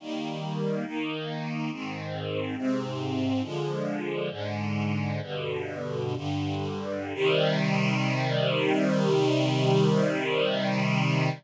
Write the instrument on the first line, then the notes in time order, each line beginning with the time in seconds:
string ensemble 1
0.00 D#3 G3 A#3
0.86 D#3 A#3 D#4
1.71 G#2 D#3 C4
2.57 G#2 C3 C4
3.43 D3 F3 G#3
4.30 G#2 D3 G#3
5.21 G2 B2 D3
6.16 G2 D3 G3
7.14 C3 D#3 G3